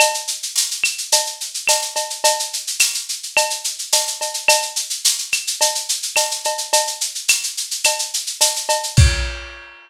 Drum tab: CC |----------------|----------------|----------------|----------------|
TB |----x-------x---|----x-------x---|----x-------x---|----x-------x---|
SH |xxxxxxxxxxxxxxxx|xxxxxxxxxxxxxxxx|xxxxxxxxxxxxxxxx|xxxxxxxxxxxxxxxx|
CB |x-------x---x-x-|x-------x---x-x-|x-------x---x-x-|x-------x---x-x-|
CL |x-----x-----x---|----x---x-------|x-----x-----x---|----x---x-------|
BD |----------------|----------------|----------------|----------------|

CC |x---------------|
TB |----------------|
SH |----------------|
CB |----------------|
CL |----------------|
BD |o---------------|